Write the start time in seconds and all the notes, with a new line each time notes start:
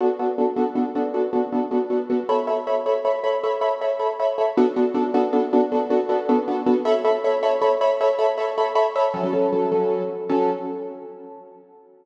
0.00 B3 D4 F#4 A4
0.19 B3 D4 F#4 A4
0.38 B3 D4 F#4 A4
0.56 B3 D4 F#4 A4
0.75 B3 D4 F#4 A4
0.95 B3 D4 F#4 A4
1.14 B3 D4 F#4 A4
1.33 B3 D4 F#4 A4
1.52 B3 D4 F#4 A4
1.71 B3 D4 F#4 A4
1.90 B3 D4 F#4 A4
2.10 B3 D4 F#4 A4
2.29 A4 C#5 E5 B5
2.47 A4 C#5 E5 B5
2.67 A4 C#5 E5 B5
2.86 A4 C#5 E5 B5
3.05 A4 C#5 E5 B5
3.24 A4 C#5 E5 B5
3.43 A4 C#5 E5 B5
3.61 A4 C#5 E5 B5
3.81 A4 C#5 E5 B5
3.99 A4 C#5 E5 B5
4.20 A4 C#5 E5 B5
4.38 A4 C#5 E5 B5
4.57 B3 D4 F#4 A4
4.76 B3 D4 F#4 A4
4.94 B3 D4 F#4 A4
5.14 B3 D4 F#4 A4
5.33 B3 D4 F#4 A4
5.53 B3 D4 F#4 A4
5.72 B3 D4 F#4 A4
5.90 B3 D4 F#4 A4
6.09 B3 D4 F#4 A4
6.29 B3 D4 F#4 A4
6.48 B3 D4 F#4 A4
6.66 B3 D4 F#4 A4
6.85 A4 C#5 E5 B5
7.05 A4 C#5 E5 B5
7.24 A4 C#5 E5 B5
7.43 A4 C#5 E5 B5
7.62 A4 C#5 E5 B5
7.81 A4 C#5 E5 B5
8.01 A4 C#5 E5 B5
8.19 A4 C#5 E5 B5
8.38 A4 C#5 E5 B5
8.58 A4 C#5 E5 B5
8.75 A4 C#5 E5 B5
8.96 A4 C#5 E5 B5
9.14 F#3 C#4 A4
9.23 F#3 C#4 A4
9.33 F#3 C#4 A4
9.52 F#3 C#4 A4
9.72 F#3 C#4 A4
10.29 F#3 C#4 A4